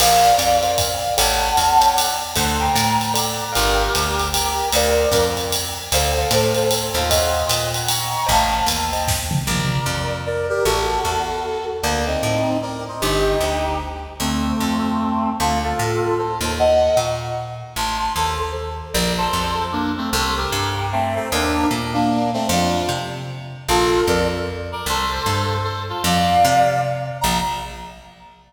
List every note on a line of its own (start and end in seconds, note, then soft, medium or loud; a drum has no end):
0.00 0.32 A#1 medium
0.00 0.31 A#4 medium
0.00 0.31 C5 loud
0.00 0.76 D5 medium
0.00 0.31 D5 loud
0.00 0.76 F5 medium
0.00 0.31 F5 medium
0.00 crash loud
0.00 ride loud
0.38 1.05 F2 medium
0.38 hi-hat pedal medium
0.38 ride loud
0.63 0.88 A#4 medium
0.63 0.88 C5 medium
0.63 0.88 D5 medium
0.63 0.88 F5 medium
0.63 ride medium
0.78 1.14 D5 medium
0.78 1.14 F5 medium
0.78 kick medium
0.78 ride loud
1.18 1.52 A1 loud
1.18 1.48 A4 medium
1.18 1.48 C#5 medium
1.18 1.48 F#5 loud
1.18 1.88 F#5 medium
1.18 1.48 G5 medium
1.18 1.88 A5 medium
1.18 ride loud
1.57 2.24 E2 medium
1.57 ride loud
1.81 2.06 A4 medium
1.81 2.06 C#5 medium
1.81 2.06 F#5 medium
1.81 2.06 G5 medium
1.81 hi-hat pedal loud
1.81 ride medium
1.96 2.16 D5 medium
1.96 2.16 F#5 medium
1.96 ride loud
2.36 2.69 D2 loud
2.36 2.66 A4 medium
2.36 2.66 C5 medium
2.36 2.66 D5 medium
2.36 2.66 F#5 loud
2.36 2.61 A5 medium
2.36 2.61 C6 medium
2.36 kick medium
2.36 ride loud
2.60 3.13 G5 medium
2.60 3.13 A#5 medium
2.75 3.42 A2 medium
2.75 hi-hat pedal loud
2.75 ride loud
3.01 ride medium
3.14 3.44 A4 medium
3.14 3.44 C5 medium
3.14 3.44 D5 medium
3.14 3.40 D5 medium
3.14 3.44 F#5 medium
3.14 3.40 F#5 medium
3.14 ride loud
3.41 3.55 D5 medium
3.41 3.55 F#5 medium
3.53 3.89 G1 medium
3.53 4.28 G4 medium
3.53 3.83 A#4 loud
3.53 4.28 A#4 medium
3.53 3.83 D5 medium
3.53 3.83 F5 loud
3.53 3.83 G5 medium
3.53 ride loud
3.95 4.62 D2 medium
3.95 hi-hat pedal medium
3.95 ride loud
4.19 ride medium
4.33 4.69 G4 medium
4.33 4.69 A#4 medium
4.33 ride loud
4.72 5.06 D2 loud
4.72 5.26 A#4 medium
4.72 5.06 A#4 medium
4.72 5.06 C5 medium
4.72 5.26 D5 medium
4.72 5.06 D5 loud
4.72 5.06 F5 loud
4.72 ride loud
5.11 5.78 F2 medium
5.11 5.45 A#4 medium
5.11 5.45 C5 medium
5.11 5.45 D5 medium
5.11 5.45 F5 medium
5.11 kick medium
5.11 hi-hat pedal loud
5.11 ride medium
5.37 ride medium
5.52 ride loud
5.92 6.25 D2 loud
5.92 6.10 A4 medium
5.92 6.71 A4 medium
5.92 6.10 C5 medium
5.92 6.71 C5 medium
5.92 6.10 D5 medium
5.92 6.10 F5 loud
5.92 ride loud
6.18 6.29 A4 medium
6.18 6.29 C5 medium
6.18 6.29 D5 medium
6.18 6.29 F5 medium
6.31 6.90 A2 medium
6.31 6.62 A4 medium
6.31 6.62 C5 medium
6.31 6.62 D5 medium
6.31 6.62 F5 medium
6.31 hi-hat pedal loud
6.31 ride loud
6.55 ride medium
6.71 6.94 A4 medium
6.71 6.94 C5 medium
6.71 ride loud
6.94 7.43 D#2 loud
6.94 7.09 F4 medium
6.94 7.09 A4 medium
7.09 7.47 C5 medium
7.09 7.40 C#5 loud
7.09 7.47 D#5 medium
7.09 7.40 D#5 medium
7.09 7.40 F5 medium
7.09 7.40 F#5 loud
7.09 kick medium
7.09 ride loud
7.49 8.16 A#2 medium
7.49 7.69 D#5 medium
7.49 7.69 F#5 medium
7.49 hi-hat pedal loud
7.49 ride loud
7.74 7.89 F#5 medium
7.74 7.88 A#5 medium
7.74 ride medium
7.88 8.24 A#5 medium
7.88 8.24 C#6 medium
7.88 ride loud
8.26 8.62 A1 loud
8.26 8.56 C5 medium
8.26 8.56 D#5 medium
8.26 8.56 G5 medium
8.26 8.56 A5 medium
8.26 kick medium
8.26 ride medium
8.30 8.66 F5 medium
8.30 8.66 A5 medium
8.66 9.33 D#2 medium
8.66 hi-hat pedal loud
8.66 ride loud
8.93 9.18 C5 medium
8.93 9.18 D#5 medium
8.93 9.18 G5 medium
8.93 9.18 A5 medium
8.93 ride medium
9.08 kick loud
9.08 snare loud
9.31 mid tom loud
9.47 9.80 A#1 medium
9.47 10.14 A#4 medium
9.47 10.14 D5 medium
9.86 10.52 F2 medium
10.26 10.47 A#4 medium
10.26 10.47 D5 medium
10.49 10.64 G4 medium
10.49 10.64 A#4 medium
10.65 10.99 A1 medium
10.65 11.65 F#4 medium
10.65 11.65 A4 medium
11.05 11.71 E2 medium
11.82 12.17 D2 medium
11.82 12.05 A#3 medium
11.82 12.05 D4 medium
12.07 12.57 C4 medium
12.07 12.57 D#4 medium
12.23 12.89 A2 medium
12.62 12.84 A#4 medium
12.62 12.84 D5 medium
12.88 13.01 C5 medium
12.88 13.01 D#5 medium
13.01 13.35 G1 medium
13.01 13.78 D#4 medium
13.01 13.78 G4 medium
13.40 14.07 D2 medium
14.20 14.53 D2 medium
14.20 15.30 A3 medium
14.20 15.30 C4 medium
14.60 15.27 F2 medium
15.40 15.73 D2 medium
15.40 15.59 F4 medium
15.40 15.59 A4 medium
15.64 16.14 F4 medium
15.64 16.14 A4 medium
15.79 16.39 A2 medium
16.18 16.38 A4 medium
16.18 16.38 C5 medium
16.41 16.89 D#2 medium
16.41 16.58 A4 medium
16.41 16.58 C5 medium
16.59 16.97 D#5 medium
16.59 16.97 F#5 medium
16.97 17.63 A#2 medium
16.97 17.18 A#5 medium
16.97 17.18 C#6 medium
17.76 18.09 A1 medium
17.76 17.97 A5 medium
17.76 17.97 C6 medium
17.99 18.13 A5 medium
17.99 18.13 C6 medium
18.16 18.82 D#2 medium
18.16 18.38 A4 medium
18.16 18.38 C5 medium
18.39 18.52 A4 medium
18.39 18.52 C5 medium
18.94 19.28 A#1 loud
18.94 19.13 A#4 medium
18.94 19.13 D5 medium
19.18 19.64 A4 medium
19.18 19.64 C5 medium
19.33 20.00 F2 medium
19.72 19.91 A#3 medium
19.72 19.91 D4 medium
19.97 20.10 A3 medium
19.97 20.10 C4 medium
20.13 20.46 C2 loud
20.13 20.35 A4 medium
20.13 20.35 C5 medium
20.37 20.86 G4 medium
20.37 20.86 A#4 medium
20.52 21.19 G2 medium
20.92 21.15 A3 medium
20.92 21.15 C4 medium
21.15 21.29 A3 medium
21.15 21.29 C4 medium
21.32 21.65 D#2 loud
21.32 21.67 A#3 medium
21.32 21.67 D4 medium
21.71 22.37 A#2 medium
21.93 22.31 A#3 medium
21.93 22.31 D4 medium
22.33 22.47 A3 medium
22.33 22.47 C4 medium
22.49 22.82 F2 loud
22.49 22.89 D4 medium
22.49 22.89 F4 medium
22.89 23.55 C3 medium
23.69 24.02 A#1 loud
23.69 24.02 F4 medium
23.69 24.02 A4 medium
24.07 24.74 F2 medium
24.07 24.28 A#4 medium
24.07 24.28 D5 medium
24.72 24.86 A#4 medium
24.72 24.86 D5 medium
24.86 25.19 C2 medium
24.86 25.57 A4 medium
24.86 25.57 C5 loud
25.26 25.93 G2 medium
25.64 25.83 A4 medium
25.64 25.83 C5 medium
25.89 26.02 F4 medium
25.89 26.02 A4 medium
26.04 26.37 F2 loud
26.04 26.80 D5 medium
26.04 26.80 F5 medium
26.45 27.11 C3 loud
27.21 27.40 A#1 loud
27.21 27.38 A#5 loud